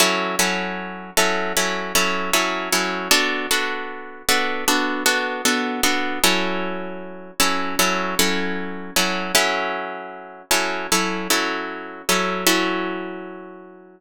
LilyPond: \new Staff { \time 4/4 \key fis \minor \tempo 4 = 77 <fis cis' e' a'>8 <fis cis' e' a'>4 <fis cis' e' a'>8 <fis cis' e' a'>8 <fis cis' e' a'>8 <fis cis' e' a'>8 <fis cis' e' a'>8 | <b d' fis' a'>8 <b d' fis' a'>4 <b d' fis' a'>8 <b d' fis' a'>8 <b d' fis' a'>8 <b d' fis' a'>8 <b d' fis' a'>8 | <fis cis' e' a'>4. <fis cis' e' a'>8 <fis cis' e' a'>8 <fis cis' e' a'>4 <fis cis' e' a'>8 | <fis cis' e' a'>4. <fis cis' e' a'>8 <fis cis' e' a'>8 <fis cis' e' a'>4 <fis cis' e' a'>8 |
<fis cis' e' a'>1 | }